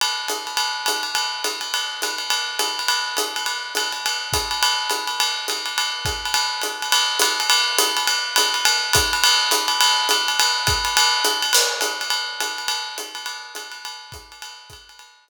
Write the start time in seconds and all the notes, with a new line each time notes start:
0.01 ride
0.28 hi-hat pedal, ride
0.47 ride
0.57 ride
0.86 hi-hat pedal, ride
1.03 ride
1.15 ride
1.44 hi-hat pedal, ride
1.61 ride
1.74 ride
2.02 hi-hat pedal, ride
2.18 ride
2.30 ride
2.59 hi-hat pedal, ride
2.79 ride
2.88 ride
3.17 hi-hat pedal, ride
3.36 ride
3.46 ride
3.75 hi-hat pedal, ride
3.92 ride
4.06 ride
4.33 kick, hi-hat pedal, ride
4.51 ride
4.63 ride
4.90 hi-hat pedal, ride
5.07 ride
5.20 ride
5.48 hi-hat pedal, ride
5.66 ride
5.78 ride
6.05 kick, hi-hat pedal, ride
6.25 ride
6.34 ride
6.62 hi-hat pedal, ride
6.82 ride
6.92 ride
7.19 hi-hat pedal, ride
7.40 ride
7.50 ride
7.78 hi-hat pedal, ride
7.97 ride
8.07 ride
8.36 hi-hat pedal, ride
8.54 ride
8.65 ride
8.93 kick, hi-hat pedal, ride
9.13 ride
9.24 ride
9.51 hi-hat pedal, ride
9.68 ride
9.81 ride
10.09 hi-hat pedal, ride
10.28 ride
10.40 ride
10.67 kick, hi-hat pedal, ride
10.85 ride
10.97 ride
11.25 hi-hat pedal, ride
11.42 ride
11.53 crash, ride
11.81 hi-hat pedal, ride
12.01 ride
12.10 ride
12.40 hi-hat pedal, ride
12.58 ride
12.68 ride
12.98 hi-hat pedal, ride
13.15 ride
13.26 ride
13.55 hi-hat pedal, ride
13.72 ride
13.85 ride
14.12 kick, hi-hat pedal, ride
14.32 ride
14.42 ride
14.70 kick, hi-hat pedal, ride
14.89 ride
14.99 ride
15.28 hi-hat pedal, ride